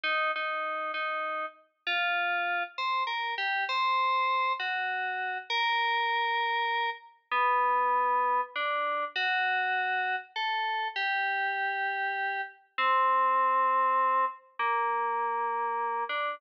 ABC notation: X:1
M:6/8
L:1/8
Q:3/8=66
K:Gm
V:1 name="Electric Piano 2"
E E2 E2 z | F3 c B G | c3 ^F3 | B5 z |
[K:G] B,4 D2 | F4 A2 | G6 | C5 z |
[K:Gm] B,5 D |]